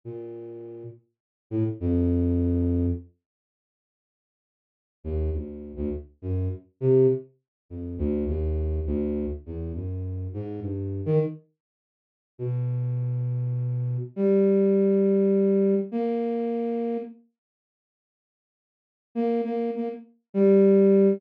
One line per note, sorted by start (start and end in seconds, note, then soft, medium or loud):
0.04 0.84 A#2 medium
1.50 1.64 A2 medium
1.80 2.86 F2 loud
5.04 5.30 D#2 medium
5.33 5.72 D2 medium
5.76 5.90 D2 loud
6.22 6.48 F#2 medium
6.81 7.07 C3 medium
7.69 7.96 F2 medium
7.98 8.25 D2 loud
8.27 8.80 D#2 medium
8.86 9.26 D2 loud
9.46 9.72 E2 medium
9.75 10.28 F#2 medium
10.34 10.60 G#2 medium
10.62 11.02 G2 medium
11.06 11.19 D#3 loud
12.38 13.97 B2 medium
14.16 15.75 G3 medium
15.92 16.97 A#3 medium
19.15 19.41 A#3 medium
19.44 19.71 A#3 medium
19.75 19.89 A#3 medium
20.34 21.13 G3 medium